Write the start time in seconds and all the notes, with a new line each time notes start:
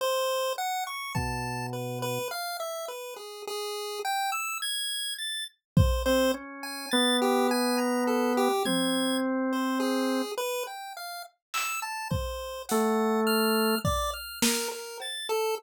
0.01 C5
0.58 F#5
0.87 C#6
1.15 B2 A5, kick
1.73 B4
2.02 B4
2.31 F5
2.60 E5
2.88 B4
3.16 G#4
3.47 G#4
4.05 G5
4.32 E6
4.62 G#6
5.19 A6
5.77 C5, kick
6.06 C4 C5
6.34 C#4
6.63 G#5
6.91 B3 A6
7.22 G4
7.51 G#5
7.78 A#5
8.07 A4
8.37 G4
8.65 C4 G#6, high tom
9.53 C5
9.80 G#4
10.37 B4
10.67 G5
10.97 F5
11.54 E6, clap
11.82 A5
12.11 C5, kick
12.69 A3 F#5, closed hi-hat
13.27 F6
13.85 D5, kick
14.13 F6
14.42 A#4, snare
14.72 A#4
15.00 A6, cowbell
15.29 A4